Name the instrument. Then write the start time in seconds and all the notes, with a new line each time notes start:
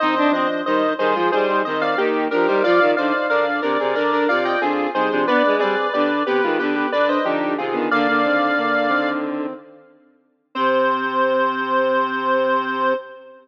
lead 1 (square)
0.00 D#3 C4 D#4 C5 D#5
0.17 D4
0.31 F3 C4 D4 C5 D#5
0.66 D#3 G3 D#4 C5 D#5
0.98 D#3 G3 D#4 G#4 C5
1.15 F3 G#3 F4
1.32 G3 D#4 G#4 C5
1.48 G3 D#4
1.65 D#3 C4 C5 D#5
1.80 D#3 C4 D5 F5
1.97 D#3 A#3 D#4 G4
2.31 F3 D4 G4 A#4
2.47 G3 D#4 C5
2.64 F3 F4 D5 F5
2.80 D#3
2.97 D3 D#4 C5 D5 F5
3.29 D3 D4 A#4 D5 F5
3.62 C3 D4 A#4 D5
3.79 C3 C4 G#4
3.95 D3 D4 A#4 D5
4.12 D4 A#4
4.29 C3 F4 D5 F5
4.44 F4 D5 D#5 G5
4.61 D3 C4 F4 G#4
4.93 C3 G3 D#4 G#4 C5
5.10 C3 F3 D4
5.27 B3 D4 B4 D5
5.45 G#3
5.59 G3 C4 G#4 B4 D5
5.93 D3 B3 G4 B4 D5
6.26 C3 B3 G4 B4
6.43 D#3 G#3 F4
6.59 D3 B3 G4 B4
6.75 B3 G4
6.92 D3 D4 B4 D5
7.08 D4 B4 C5 D#5
7.24 D3 F3 D4 D#4 G4
7.58 C3 D#3 C4 F4 G#4
7.73 D3 D#3 B3
7.91 D3 A#3 D5 F5
8.07 D3 A#3
8.24 D#3 C4
8.58 D3 A#3
8.89 D#3 C4
10.55 C3 C4 C5